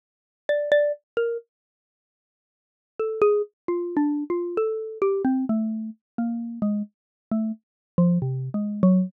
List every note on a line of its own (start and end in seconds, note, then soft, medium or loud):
0.49 0.70 D5 medium
0.72 0.92 D5 loud
1.17 1.37 A#4 medium
2.99 3.20 A4 medium
3.21 3.42 G#4 loud
3.68 3.95 F4 medium
3.97 4.24 D4 medium
4.30 4.57 F4 medium
4.57 4.98 A4 medium
5.02 5.22 G4 medium
5.24 5.45 C4 medium
5.49 5.90 A3 medium
6.18 6.59 A#3 medium
6.62 6.82 G#3 medium
7.31 7.52 A3 medium
7.98 8.18 F3 loud
8.22 8.49 C3 medium
8.54 8.81 G#3 medium
8.83 9.10 F#3 loud